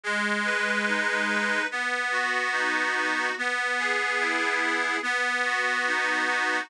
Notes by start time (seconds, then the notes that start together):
0.03 G#3
0.45 B4
0.87 D#4
1.28 B4
1.71 B3
2.11 F#4
2.52 D#4
2.96 F#4
3.38 B3
3.79 G#4
4.20 E4
4.61 G#4
5.03 B3
5.45 F#4
5.87 D#4
6.28 F#4